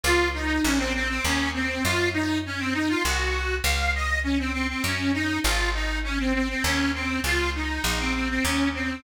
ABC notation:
X:1
M:3/4
L:1/16
Q:1/4=100
K:Db
V:1 name="Accordion"
F2 E2 D C C C D2 C2 | F2 E2 D C E F G4 | f2 e2 D C C C D2 E2 | F2 E2 D C C C D2 C2 |
F2 E2 E C C C D2 C2 |]
V:2 name="Electric Bass (finger)" clef=bass
D,,4 B,,,4 E,,4 | G,,8 C,,4 | D,,8 G,,4 | A,,,8 E,,4 |
D,,4 B,,,4 E,,4 |]